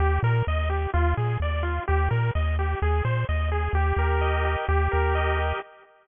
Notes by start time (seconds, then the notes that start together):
0.00 D#2 G4
0.23 A#2 A#4
0.47 D#2 D#5
0.70 G4
0.94 D#2 F4
1.17 A#2 G#4
1.40 D#2 D5
1.63 F4
1.88 D#2 G4
2.11 A#2 A#4
2.35 D#2 D#5
2.59 G4
2.82 D#2 G#4
3.05 A#2 C5
3.29 D#2 D#5
3.52 G#4
3.73 D#2 G4
3.97 D#2 A#4
4.21 D#5
4.45 G4
4.69 D#2 G4
4.92 D#2 A#4
5.15 D#5
5.38 G4